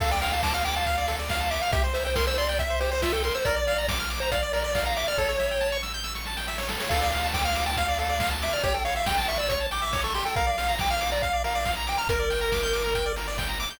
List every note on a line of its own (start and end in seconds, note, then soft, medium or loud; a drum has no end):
0.00 1.59 D2 medium
0.00 0.10 A4 loud
0.00 0.11 F5 loud
0.00 kick loud
0.00 crash loud
0.11 0.21 D5 medium
0.11 0.31 G5 medium
0.21 0.31 F5 medium
0.21 open hi-hat loud
0.32 0.42 F5 loud
0.32 0.42 A5 medium
0.43 0.53 A5 loud
0.43 0.53 D6 medium
0.43 kick loud
0.43 snare loud
0.54 0.64 F5 medium
0.54 0.63 F6 medium
0.64 0.75 G5 loud
0.64 0.75 D6 medium
0.64 open hi-hat medium
0.76 1.16 F5 medium
0.76 0.86 A5 medium
0.86 0.96 F5 medium
0.86 kick loud
0.86 closed hi-hat loud
0.97 1.07 D5 medium
1.08 1.17 A4 medium
1.08 open hi-hat loud
1.19 1.28 D5 medium
1.29 1.39 F5 loud
1.29 1.52 F5 medium
1.29 kick loud
1.29 snare loud
1.40 1.50 A5 medium
1.51 1.61 E5 loud
1.51 1.60 D6 medium
1.51 open hi-hat medium
1.61 1.71 F5 loud
1.61 1.72 F6 medium
1.72 3.30 C2 medium
1.72 1.82 G4 loud
1.72 1.83 E5 loud
1.72 kick loud
1.72 closed hi-hat loud
1.84 1.93 C5 medium
1.93 2.04 C5 medium
1.93 2.04 E5 medium
1.93 open hi-hat loud
2.05 2.17 C5 medium
2.05 2.14 G5 medium
2.15 2.26 A#4 loud
2.15 2.25 C6 medium
2.15 kick loud
2.15 snare loud
2.27 2.37 C5 medium
2.27 2.37 E6 medium
2.38 2.58 D5 medium
2.38 2.47 C6 medium
2.38 open hi-hat medium
2.49 2.58 G5 medium
2.59 2.68 E5 medium
2.59 2.79 E5 medium
2.59 kick loud
2.59 closed hi-hat loud
2.70 2.79 C5 medium
2.80 2.90 G4 medium
2.80 2.91 C5 loud
2.80 open hi-hat medium
2.91 3.01 C5 medium
2.91 3.03 C5 loud
3.02 3.12 F4 medium
3.02 3.12 E5 loud
3.02 kick medium
3.02 snare loud
3.12 3.22 A4 loud
3.12 3.23 G5 medium
3.23 3.35 A#4 medium
3.23 3.33 C6 medium
3.23 open hi-hat medium
3.34 3.45 C5 loud
3.34 3.44 E6 medium
3.45 5.04 A#1 medium
3.45 3.55 A#4 loud
3.45 3.87 D5 loud
3.45 kick loud
3.45 closed hi-hat loud
3.56 3.66 D5 medium
3.67 3.77 F5 medium
3.67 open hi-hat medium
3.78 3.88 A#5 medium
3.88 3.98 D6 medium
3.88 kick loud
3.88 snare loud
3.99 4.09 F6 medium
4.10 4.19 D6 medium
4.10 open hi-hat medium
4.20 4.30 C5 loud
4.20 4.31 A#5 medium
4.31 4.52 D5 medium
4.31 4.41 F5 medium
4.31 kick loud
4.31 closed hi-hat loud
4.42 4.52 D5 medium
4.53 4.63 A#4 medium
4.53 4.84 D5 medium
4.53 open hi-hat loud
4.64 4.74 D5 medium
4.75 4.85 F5 medium
4.75 kick loud
4.75 snare loud
4.85 4.97 F5 medium
4.85 4.95 A#5 medium
4.96 5.07 E5 medium
4.96 5.06 D6 medium
4.96 open hi-hat loud
5.07 5.18 D5 medium
5.07 5.17 F6 medium
5.18 6.77 A1 medium
5.18 5.28 A4 loud
5.18 5.77 C#5 loud
5.18 kick loud
5.18 snare medium
5.29 5.38 C#5 medium
5.39 5.49 E5 medium
5.39 snare medium
5.51 5.61 G5 medium
5.61 5.70 A5 medium
5.61 snare medium
5.72 5.82 C#6 medium
5.83 5.92 E6 medium
5.83 snare medium
5.94 6.04 G6 medium
6.04 6.13 E6 medium
6.04 snare medium
6.15 6.25 C#6 medium
6.15 snare medium
6.25 6.36 A5 medium
6.25 snare medium
6.37 6.46 G5 medium
6.37 snare loud
6.47 6.57 E5 medium
6.47 snare loud
6.58 6.68 C#5 medium
6.58 snare loud
6.69 6.79 A4 medium
6.69 snare loud
6.80 6.90 C#5 medium
6.80 snare loud
6.89 8.49 D2 medium
6.89 7.00 A4 loud
6.89 7.27 F5 medium
6.89 kick loud
6.89 crash loud
7.01 7.11 D5 medium
7.12 7.22 F5 medium
7.12 open hi-hat loud
7.23 7.33 A5 medium
7.34 7.44 G5 medium
7.34 7.44 D6 medium
7.34 kick loud
7.34 snare loud
7.44 7.65 F5 medium
7.44 7.55 F6 medium
7.55 7.65 D6 medium
7.55 open hi-hat loud
7.66 7.76 G5 medium
7.66 7.76 A5 medium
7.77 7.87 F5 medium
7.77 7.98 F5 medium
7.77 kick loud
7.77 closed hi-hat loud
7.88 7.98 D5 medium
7.98 8.08 A4 medium
7.98 8.30 F5 medium
7.98 open hi-hat medium
8.09 8.19 D5 medium
8.20 8.30 F5 medium
8.20 kick loud
8.20 snare loud
8.31 8.41 A5 medium
8.42 8.53 E5 medium
8.42 8.52 D6 medium
8.42 open hi-hat loud
8.53 8.63 D5 medium
8.53 8.62 F6 medium
8.63 10.23 A1 medium
8.63 8.73 G4 loud
8.63 8.74 C#5 loud
8.63 kick loud
8.63 closed hi-hat loud
8.74 8.83 A4 medium
8.74 8.84 G5 loud
8.85 8.95 C#5 medium
8.85 8.95 F5 medium
8.85 open hi-hat medium
8.96 9.05 E5 medium
8.96 9.07 F5 loud
9.06 9.16 G5 medium
9.06 9.28 G5 loud
9.06 kick loud
9.06 snare loud
9.18 9.27 A5 medium
9.28 9.38 E5 medium
9.28 9.38 C#6 medium
9.28 open hi-hat loud
9.37 9.48 D5 medium
9.37 9.49 E6 medium
9.48 9.66 C#5 medium
9.48 9.59 C#6 medium
9.48 kick loud
9.48 closed hi-hat loud
9.60 9.70 A5 medium
9.71 9.81 G5 medium
9.71 10.01 D6 loud
9.71 open hi-hat loud
9.82 9.91 E5 medium
9.93 10.03 C#5 medium
9.93 kick loud
9.93 snare loud
10.04 10.13 A4 medium
10.04 10.14 C#6 loud
10.14 10.24 G4 medium
10.14 10.24 C6 medium
10.14 open hi-hat loud
10.25 10.35 A4 medium
10.25 10.35 G5 medium
10.36 11.96 A#1 medium
10.36 10.46 A#4 loud
10.36 10.75 F5 loud
10.36 kick loud
10.36 closed hi-hat loud
10.47 10.56 D5 medium
10.58 10.67 F5 medium
10.58 open hi-hat loud
10.69 10.78 A#5 medium
10.79 10.91 G5 loud
10.79 10.89 D6 medium
10.79 kick loud
10.79 snare loud
10.90 11.10 F5 loud
10.90 11.00 F6 medium
11.00 11.10 D6 medium
11.00 open hi-hat loud
11.11 11.22 D5 medium
11.11 11.21 A#5 medium
11.22 11.43 F5 loud
11.22 11.32 F5 medium
11.22 kick loud
11.22 closed hi-hat loud
11.33 11.43 D5 medium
11.44 11.54 A#4 medium
11.44 11.72 F5 medium
11.44 open hi-hat loud
11.55 11.65 D5 medium
11.65 11.75 F5 medium
11.65 kick loud
11.65 snare loud
11.76 11.86 A#5 medium
11.87 11.99 G5 medium
11.87 11.97 D6 medium
11.87 open hi-hat loud
11.98 12.08 A#5 loud
11.98 12.08 F6 medium
12.07 13.66 G1 medium
12.07 12.19 A#4 loud
12.07 13.12 A#4 loud
12.07 kick loud
12.07 closed hi-hat loud
12.19 12.29 D5 medium
12.30 12.40 G5 medium
12.30 open hi-hat loud
12.41 12.51 A#5 medium
12.52 12.62 D6 medium
12.52 kick loud
12.52 snare loud
12.63 12.73 G6 medium
12.73 12.82 D6 medium
12.73 open hi-hat loud
12.84 12.93 A#5 medium
12.95 13.05 G5 medium
12.95 kick medium
12.95 closed hi-hat loud
13.06 13.15 D5 medium
13.16 13.27 A#4 medium
13.16 open hi-hat loud
13.28 13.37 D5 medium
13.38 13.48 G5 medium
13.38 kick loud
13.38 snare loud
13.49 13.58 A#5 medium
13.60 13.69 D6 loud
13.60 open hi-hat medium
13.70 13.79 G6 medium